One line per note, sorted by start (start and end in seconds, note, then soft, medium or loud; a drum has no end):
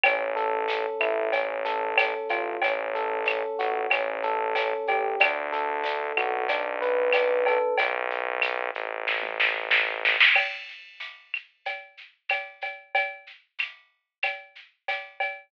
0.03 0.87 A1 medium
0.03 0.68 C#4 loud
0.03 cowbell medium
0.03 claves medium
0.03 shaker medium
0.36 1.28 A4 medium
0.36 shaker medium
0.68 1.30 C#4 medium
0.68 tambourine medium
0.68 shaker loud
1.00 2.15 A1 medium
1.00 1.31 E4 medium
1.00 claves medium
1.00 shaker medium
1.33 1.97 C#4 medium
1.33 cowbell medium
1.33 shaker medium
1.65 2.57 A4 medium
1.65 shaker medium
1.97 2.59 C#4 medium
1.97 tambourine medium
1.97 cowbell medium
1.97 claves medium
1.97 shaker loud
2.29 2.58 A1 medium
2.29 2.60 F4 medium
2.29 cowbell medium
2.29 shaker medium
2.62 3.44 A1 medium
2.62 3.26 C#4 medium
2.62 cowbell medium
2.62 shaker medium
2.95 3.87 A4 medium
2.95 shaker medium
3.26 3.88 C#4 medium
3.26 tambourine medium
3.26 claves medium
3.26 shaker medium
3.59 3.87 A1 medium
3.59 3.90 F#4 medium
3.59 shaker medium
3.90 4.74 A1 medium
3.90 4.55 C#4 medium
3.90 cowbell medium
3.90 claves medium
3.90 shaker medium
4.23 5.16 A4 medium
4.23 shaker medium
4.55 5.17 C#4 medium
4.55 tambourine medium
4.55 cowbell medium
4.55 shaker loud
4.87 5.16 A1 medium
4.87 5.19 G4 medium
4.87 cowbell medium
4.87 shaker medium
5.20 6.12 D2 medium
5.20 5.84 D4 medium
5.20 cowbell medium
5.20 claves loud
5.20 shaker loud
5.52 6.44 A4 medium
5.52 shaker medium
5.84 6.46 D4 medium
5.84 tambourine medium
5.84 shaker loud
6.17 7.59 B1 loud
6.17 6.48 F#4 medium
6.17 claves medium
6.17 shaker medium
6.49 7.13 D4 medium
6.49 cowbell medium
6.49 shaker loud
6.82 7.74 B4 medium
6.82 shaker medium
7.12 7.75 D4 medium
7.12 tambourine medium
7.12 cowbell medium
7.12 claves medium
7.12 shaker loud
7.46 7.77 A4 medium
7.46 cowbell medium
7.46 shaker medium
7.78 8.71 B1 loud
7.78 cowbell medium
7.78 shaker loud
8.10 shaker medium
8.42 tambourine medium
8.42 claves medium
8.42 shaker loud
8.75 10.17 A1 medium
8.75 shaker medium
9.07 kick medium
9.07 snare medium
9.23 high tom medium
9.40 snare medium
9.55 mid tom medium
9.71 snare medium
9.88 floor tom medium
10.05 snare medium
10.20 snare loud
10.35 crash medium
10.35 cowbell medium
10.35 claves medium
10.68 shaker medium
11.00 tambourine medium
11.00 shaker medium
11.34 claves medium
11.34 shaker medium
11.65 cowbell medium
11.65 shaker medium
11.97 shaker medium
12.29 tambourine medium
12.29 cowbell medium
12.29 claves medium
12.29 shaker medium
12.61 cowbell medium
12.61 shaker medium
12.95 cowbell medium
12.95 shaker medium
13.27 shaker medium
13.59 tambourine medium
13.59 claves medium
13.59 shaker medium
14.23 cowbell medium
14.23 claves medium
14.23 shaker medium
14.55 shaker medium
14.88 tambourine medium
14.88 cowbell medium
14.88 shaker medium
15.20 cowbell medium
15.20 shaker medium